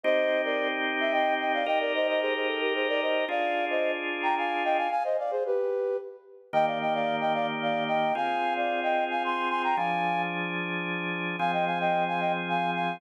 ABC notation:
X:1
M:3/4
L:1/16
Q:1/4=111
K:Cm
V:1 name="Flute"
[ce]3 [Bd]2 z2 =e [_eg]2 [eg] [df] | [eg] [Bd] [ce] [ce] [Ac] [Ac] =A [GB] [_Ac] [Bd] [ce]2 | [df]3 [ce]2 z2 [gb] [fa]2 [eg] [fa] | [fa] [ce] [df] [Ac] [G=B]4 z4 |
[K:Eb] [eg] [df] [eg] [df]2 [eg] [df] z [df]2 [eg]2 | [fa]3 [df]2 [eg]2 [fa] [ac']2 [ac'] [gb] | [fa]4 z8 | [fa] [eg] [fa] [eg]2 [fa] [eg] z [fa]2 [fa]2 |]
V:2 name="Drawbar Organ"
[CEG]12 | [EGB]12 | [DFA]12 | z12 |
[K:Eb] [E,B,G]12 | [CFA]12 | [F,DA]12 | [F,CA]12 |]